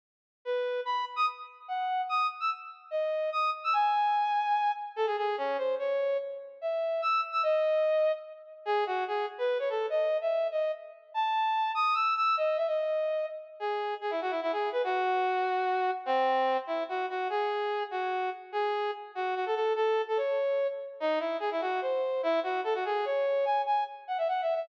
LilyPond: \new Staff { \time 3/4 \key cis \minor \tempo 4 = 146 r4 b'4 b''8 r16 dis'''16 | r4 fis''4 dis'''8 r16 e'''16 | r4 dis''4 dis'''8 r16 e'''16 | gis''2~ gis''8 r8 |
a'16 gis'16 gis'8 cis'8 bis'8 cis''4 | r4 e''4 e'''8 r16 e'''16 | dis''2 r4 | gis'8 fis'8 gis'8 r16 b'8 cis''16 a'8 |
dis''8. e''8. dis''8 r4 | a''4. dis'''8 e'''8 e'''8 | dis''8 e''16 dis''4.~ dis''16 r8 | gis'4 gis'16 e'16 fis'16 e'16 e'16 gis'8 b'16 |
fis'2. | bis4. e'8 fis'8 fis'8 | gis'4. fis'4 r8 | gis'4 r8 fis'8 fis'16 a'16 a'8 |
a'8. a'16 cis''4. r8 | dis'8 e'8 gis'16 e'16 fis'8 bis'4 | e'8 fis'8 a'16 fis'16 gis'8 cis''4 | gis''8 gis''8 r8 fis''16 e''16 \tuplet 3/2 { fis''8 e''8 e''8 } | }